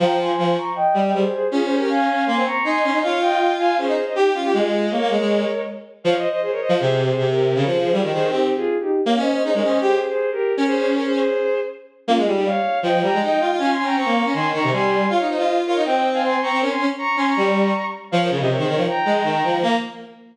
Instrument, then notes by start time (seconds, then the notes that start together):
violin
0.00 F3 G5 A#5
0.19 G#5 C6
0.38 F3
0.57 A#5 C#6
0.75 D#5 G5
0.94 G3
1.04 D#5 G5
1.13 G3 G#4 C5
1.32 G#4 C5
1.51 C#4 F4 G#4
1.63 G#4 C5
1.76 G4 A#4
1.89 F5 G#5
2.27 A#3 G#5 C6
2.36 C4
2.45 A#5 C#6
2.64 D#4 G#5 C6
2.84 C#4
2.93 D#4
3.02 F4 C#5 F5
3.21 D#5 G5
3.58 F5 G#5
3.78 C#4 G#4 C5
3.87 D#4
4.06 C5 D#5
4.15 D#4 G4
4.34 C#4 F4
4.44 G4
4.53 G#3 F4 G#4
4.90 A#3 A#4 C#5
5.00 A#3
5.10 G#3
5.19 G#3
6.04 F3 C#5 F5
6.16 C5 D#5
6.29 C5 D#5
6.42 G#4 C5
6.51 A#4 C#5
6.60 C5 D#5
6.69 F3
6.79 C3 G#4 C5
7.04 G#4 C5
7.17 C3
7.29 G4 A#4
7.55 C#3 A#4 C#5
7.65 F3 G#4 C5
7.80 G#4 C5
7.92 G3 F4 G#4
8.02 D#3 G4 A#4
8.11 D#3 G#4 C5
8.30 C4 D#4 G4
8.56 F4 G#4
8.80 D#4 G4
9.06 A#3 C#5 F5
9.16 C#4 C5 D#5
9.31 C5 D#5
9.43 D#4 G#4 C5
9.53 G#3 A#4 C#5
9.62 C#4 C5 D#5
9.81 G4 G#4 C5
10.06 G#4 C5
10.31 G4 A#4
10.57 C#4 A#4 C#5
10.66 G#4 C5
10.75 G#4 C5
10.94 A#4 C#5
11.04 G#4 C5
11.13 G#4 C5
12.07 A#3 C#4 F4
12.17 G#3 F4 G#4
12.26 G3
12.33 D#4 G4
12.45 C#5 F5
12.83 F3 D#5 G5
12.93 F3
13.02 G3 G5 A#5
13.13 G#3
13.21 D#4 D#5 G5
13.40 F4
13.50 F4
13.58 C#4 F5 G#5
13.71 G#5 C6
13.79 C#4
13.84 G5 A#5
13.96 C4 A#5 C#6
14.05 A#3
14.24 C#4
14.34 D#3 G#5 C6
14.53 D#3 A#5 C#6
14.63 C3
14.72 G3 G#5 C6
15.09 F4 C#5 F5
15.20 D#4
15.28 D#4 C5 D#5
15.38 F4
15.66 F4 A#4 C#5
15.76 D#4
15.85 C4 D#5 G5
16.13 F5 G#5
16.23 G#5 C6
16.41 C4 A#5 C#6
16.51 C4
16.61 C#4 A#4 C#5
16.70 G#5 C6
16.79 C#4
16.98 A#5 C#6
17.17 C#4 G#5 C6
17.26 A#5 C#6
17.36 G3
18.11 F3 C#5 F5
18.21 A#4 C#5
18.30 C#3 A#4 C#5
18.39 C3 C5 D#5
18.49 A#4 C#5
18.58 D#3 G#4 C5
18.67 D#3 A#4 C#5
18.76 F3
18.87 G5 A#5
19.05 G#3
19.24 D#3
19.43 F3
19.62 A#3 A#5